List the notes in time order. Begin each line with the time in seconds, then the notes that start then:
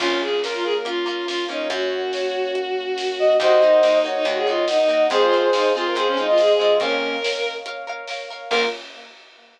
0.00 A#1 A#3 C#4 F4, kick, crash
0.20 G#4
0.43 A#3 C#4 F4 A#4, snare
0.54 F4
0.64 G#4
0.85 A#3 C#4 F4, closed hi-hat
1.06 A#3 C#4 F4
1.27 A#3 C#4 F4, snare
1.48 A#3 C#4 D#4 F4 C#5
1.70 F#2 A#3 C#4 F#4 C#5, kick, closed hi-hat
2.13 C#5, snare
2.55 closed hi-hat
2.98 snare
3.19 D#5
3.39 D#2 A#3 D#4 F#4 A#4 C5 D#5 F#5, kick, closed hi-hat
3.61 A#3 D#4 F#4
3.82 A#3 D#4 F#4, snare
4.04 A#3 D#4 F#4 C#5
4.15 D#4
4.25 D#2 A#3 D#4 F#4, closed hi-hat
4.36 G#4
4.47 A#3 D#4 F4 F#4
4.68 D#4 D#5, snare
4.79 D#4
4.88 A#3 D#4 F#4
5.10 F2 G#3 C4 F4 G#4 C5 F5, kick, closed hi-hat
5.21 F4
5.32 G#3 C4 F4
5.53 G#3 C4 D#4 F4, snare
5.74 G#3 C4 F4 G#4
5.87 A#4
5.95 F2 G#3 C4 F4 G#4 C5, closed hi-hat
6.07 C#4
6.17 G#3 C4 D#4 F4
6.27 F4 D#5
6.38 G#4, snare
6.59 G#3 C4 F4 D#5
6.80 F2 A#3 C#4 A#4 C#5 F5, kick, closed hi-hat
7.24 A#4 C#5 F5, snare
7.66 A#4 C#5 F5, closed hi-hat
7.87 A#4 C#5 F5
8.08 A#4 C#5 F5, snare
8.30 A#4 C#5 F5
8.50 A#1 A#3 C#4 F4 A#4, kick, crash